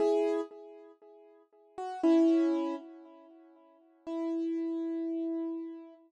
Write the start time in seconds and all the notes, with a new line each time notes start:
0.00 E4 G#4
1.78 F#4
2.03 C#4 E4
4.07 E4